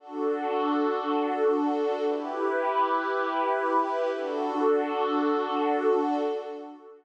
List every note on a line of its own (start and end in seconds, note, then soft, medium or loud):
0.00 2.03 D4 medium
0.00 2.03 F#4 medium
0.00 2.03 A4 medium
2.06 4.11 E4 medium
2.06 4.11 G4 medium
2.06 4.11 B4 medium
4.13 6.18 D4 medium
4.13 6.18 F#4 medium
4.13 6.18 A4 medium